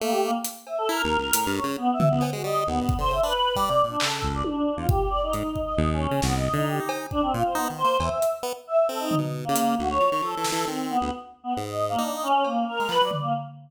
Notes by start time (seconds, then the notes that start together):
0.00 A3 A#3
0.11 G4
0.23 A#3
0.44 closed hi-hat
0.67 E5, cowbell
0.78 A4
0.89 E4 A#4
1.04 D#2
1.18 C#2
1.33 A2, closed hi-hat
1.46 G2
1.56 C#5
1.64 C#3
1.77 B3
1.93 E5
1.99 B2, floor tom
2.08 C#2 B3
2.21 B3, cowbell
2.33 G#3 F#4
2.44 G3 D#5
2.66 D#2 B3
2.81 G2
2.89 kick
2.98 D3 C5
3.11 C#3 E5
3.23 D4 B4
3.56 G3 D5, kick
3.69 C3
3.84 A#2
3.89 D4
4.00 C#3 A4, clap
4.22 C#2, kick
4.34 D5
4.44 D4, high tom
4.77 E2 F4
4.89 G4, kick
5.10 D5
5.23 D#4
5.33 G#2 D#4, closed hi-hat
5.56 kick
5.63 D#5
5.77 D#2
5.93 C#4
6.11 C#3
6.22 C2 B3, snare
6.34 D#5
6.53 D3 D#4
6.67 G4
6.78 D#4 G4
6.89 cowbell
7.11 D4, kick
7.22 C4
7.33 A#2 F4
7.45 C5
7.55 B3 D#4
7.70 D#3
7.78 C5
7.84 A#3
8.00 E2 E5, cowbell
8.22 closed hi-hat
8.43 B3
8.67 E5
8.88 C4 A4
8.99 D#4
9.11 floor tom
9.18 B2
9.45 A#3
9.49 C#3
9.56 closed hi-hat
9.78 D2 F#4
9.89 C#5
10.00 F3
10.12 D#3
10.21 F3 A4
10.37 E3
10.44 snare
10.52 E3
10.67 D#3 C4
10.90 B3
10.99 D2 B3
11.44 B3
11.57 G#2
11.65 D#5
11.89 A#3
11.98 D4 D#4
12.12 D#5
12.23 C#4
12.44 A#3, cowbell
12.67 A#4
12.80 G#3
12.89 F3 B4, clap
13.01 F#3 D5
13.11 floor tom
13.20 A#3